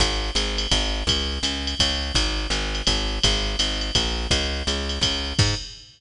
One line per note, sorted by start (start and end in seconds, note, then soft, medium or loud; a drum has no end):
0.00 0.31 G#1 loud
0.00 kick medium
0.00 ride loud
0.35 0.67 G#1 loud
0.35 hi-hat pedal loud
0.35 ride loud
0.58 ride loud
0.71 1.03 G#1 loud
0.71 kick medium
0.71 ride loud
1.07 1.39 C#2 loud
1.07 kick medium
1.07 ride loud
1.43 1.75 C#2 medium
1.43 hi-hat pedal loud
1.43 ride loud
1.67 ride medium
1.80 2.12 C#2 loud
1.80 kick medium
1.80 ride loud
2.15 2.47 G#1 loud
2.15 kick medium
2.15 ride loud
2.50 2.82 G#1 loud
2.50 hi-hat pedal medium
2.50 ride medium
2.75 ride medium
2.87 3.19 G#1 loud
2.87 kick medium
2.87 ride loud
3.23 3.56 G#1 loud
3.23 kick medium
3.23 ride loud
3.59 3.91 G#1 loud
3.59 hi-hat pedal loud
3.59 ride loud
3.81 ride medium
3.95 4.27 A#1 medium
3.95 kick medium
3.95 ride loud
4.31 4.63 C#2 loud
4.31 kick medium
4.31 ride loud
4.67 4.99 C#2 loud
4.67 hi-hat pedal medium
4.67 ride loud
4.89 ride medium
5.01 5.33 C#2 medium
5.01 kick medium
5.01 ride loud
5.39 5.55 G#2 loud
5.39 kick loud
5.39 crash loud